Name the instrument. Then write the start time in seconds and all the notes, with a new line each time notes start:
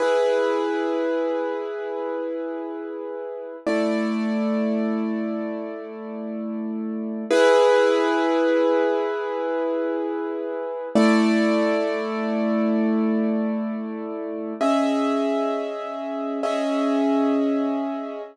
acoustic grand piano
0.00 E4 G#4 B4
3.67 A3 E4 D5
7.31 E4 G#4 B4
10.95 A3 E4 D5
14.61 C#4 G#4 D#5 E5
16.43 C#4 G#4 D#5 E5